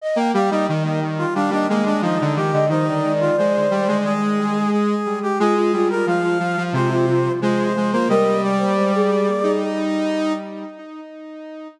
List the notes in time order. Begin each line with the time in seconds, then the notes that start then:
0.02 D#5
0.15 A#3 G5
0.34 G3 G4 F5
0.50 G3 D#4 D#5
0.67 D#3 D#5
0.84 D#5
1.18 F4
1.34 G3 D4 F5
1.50 G3 D4 D#5
1.67 G#3 A#3 D#5
1.85 G#3 D4
2.02 F3 D#4 D#5
2.21 D3
2.36 D#3 G4
2.53 D3 D#5
2.69 D#3 D#4 C5
2.87 D5
3.20 F4
3.37 G#3 C5
3.71 G3
3.88 G#3
4.04 G#4
4.72 G#4
5.22 G4
5.39 G#3 F4 G#4
5.56 F4
5.73 G3 F4
5.90 F4 A#4
6.06 F3 F4 F5
6.22 F4
6.39 F3
6.57 F3
6.73 C3 F4 C5
6.90 F4
7.08 F4
7.42 G#3 F4 C5
7.77 G#3
7.92 A#3 F4 C5
8.09 G3 A#4 D#5
8.43 D5
8.58 C5
8.76 C5
8.95 G#4
9.43 D#4